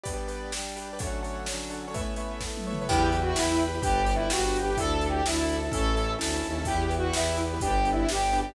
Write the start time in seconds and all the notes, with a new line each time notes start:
0.03 G3 B3 D4 G4 B4 D5, kick, closed hi-hat
0.14 G4 B4 D5
0.28 G4 B4 D5, closed hi-hat
0.52 G3 D4 G4, snare
0.76 G4 B4 D5, closed hi-hat
0.93 G4 B4 D5
0.99 D3 F#3 A3 C#4 D4 A4 C#5 F#5, kick, closed hi-hat
1.07 D4 A4 C#5 F#5
1.23 D4 A4 C#5 F#5, closed hi-hat
1.46 D3 F#3 C#4 D4, snare
1.70 D4 A4 C#5 F#5, closed hi-hat
1.88 D4 A4 C#5 F#5
1.94 A3 B3 C#4 E4 B4 C#5 E5, kick, closed hi-hat
2.01 A3 B4 C#5 E5
2.16 A3 B4 C#5 E5, closed hi-hat
2.41 A3 B3 E4 A4, kick, snare
2.57 high tom
2.67 A3 B4 C#5 E5
2.73 mid tom
2.81 A3 B4 C#5 E5
2.88 E2 E4 G4 B4 E5 G5, kick, crash
3.12 E4 G4 B4, closed hi-hat
3.21 F#4
3.35 E2 E4 G4 B4 G5 B5, snare
3.52 E4 G4 B4
3.59 closed hi-hat
3.68 E4 G4 B4
3.75 E4 G4 B4
3.82 G1 D4 G4 B4 D5 G5, kick, closed hi-hat
4.06 D4 G4 B4, closed hi-hat
4.15 E4
4.29 G1 D4 F#4 G4 B4 G5, snare
4.45 D4 G4 B4
4.56 closed hi-hat
4.62 D4 G4 B4
4.70 D4 G4 B4
4.77 D2 D4 E4 A4 D5 E5, kick, closed hi-hat
5.01 D4 E4 A4, closed hi-hat
5.09 G4
5.25 D2 D4 E4 A4 E5 A5, snare
5.42 D4 E4 A4
5.49 closed hi-hat
5.56 D4 E4 A4
5.64 D4 E4 A4
5.71 A1 C#4 E4 A4 C#5 E5, kick, closed hi-hat
5.95 C#4 E4 A4, closed hi-hat
6.19 D2 C#4 E4 A4 E5 A5, snare
6.34 C#4 E4 A4
6.43 D#2, closed hi-hat
6.50 C#4 E4 A4
6.58 C#4 E4 A4
6.65 E2 B3 E4 G4 B4, kick, closed hi-hat
6.75 E4 G4 B4
6.89 E4 G4 B4, closed hi-hat
6.98 F#4
7.13 E2 B3 E4 G4 B4, snare
7.37 E4 G4 B4, closed hi-hat
7.54 E4 G4 B4
7.60 G1 B3 D4 G4 B4, kick, closed hi-hat
7.67 D4 G4 B4
7.85 D4 G4 B4, closed hi-hat
7.92 E4
8.08 G1 G3 B3 G4, snare
8.32 D4 G4 B4, closed hi-hat
8.40 G4
8.49 D4 G4 B4